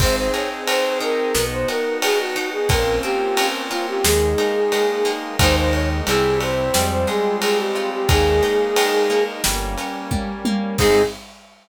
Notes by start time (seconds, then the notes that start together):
0.00 G#1 C4 D#4 G#4 C5, kick, crash
0.16 C5
0.34 G#4 C#5, ride
0.67 C4 C5, ride
1.00 D#4 A#4, ride
1.34 B1 B3 D#4 F#4, snare
1.52 C5
1.68 F#4 A#4, ride
2.02 B3 G#4, ride
2.19 F#4
2.36 D#4, ride
2.52 G#4
2.69 A#1 A#3 C4 C#4 F4 A#4, kick, ride
3.03 C4 G4, ride
3.37 C#4, ride
3.71 F4, ride
3.88 G4
4.04 D#2 G#3 A#3 D#4 G#4, snare
4.38 D#4, ride
4.72 G#3, ride
5.05 A#3, ride
5.39 D#2 G#3 A#3 D#4 C5, kick, ride
5.56 C5
5.73 C#5, ride
6.07 C2 G3 C4 E4 G#4, ride
6.40 C5, ride
6.74 F2 G3 G#3 C4 F4, snare
6.91 C5
7.07 G#3 G#4, ride
7.42 C4 G#4, ride
7.58 G4
7.75 F4, ride
7.92 G4
8.08 D#2 G#3 A#3 D#4 G#4, kick, ride
8.43 D#4, ride
8.76 G#3, ride
9.10 A#3, ride
9.44 G1 G3 A#3 C#4, snare
9.78 C#4, ride
10.11 G3, kick, high tom
10.45 A#3, high tom
10.78 G#2 C4 D#4 G#4, kick, crash